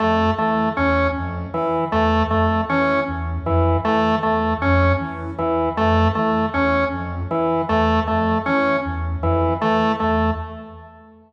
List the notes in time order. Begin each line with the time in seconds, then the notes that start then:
0.00 F2 A3
0.38 E3 A3
0.77 E2 C#4
1.16 F2
1.54 E3
1.92 E2 A3
2.31 F2 A3
2.69 E3 C#4
3.08 E2
3.46 F2 E3
3.85 E3 A3
4.23 E2 A3
4.62 F2 C#4
5.00 E3
5.38 E2 E3
5.77 F2 A3
6.15 E3 A3
6.54 E2 C#4
6.92 F2
7.31 E3
7.69 E2 A3
8.08 F2 A3
8.46 E3 C#4
8.85 E2
9.23 F2 E3
9.62 E3 A3
10.00 E2 A3